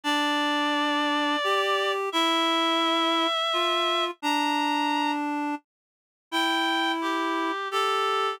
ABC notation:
X:1
M:3/4
L:1/8
Q:1/4=86
K:F
V:1 name="Clarinet"
d6 | e6 | b3 z3 | g2 G2 A2 |]
V:2 name="Clarinet"
D4 G2 | E4 F2 | D4 z2 | E4 G2 |]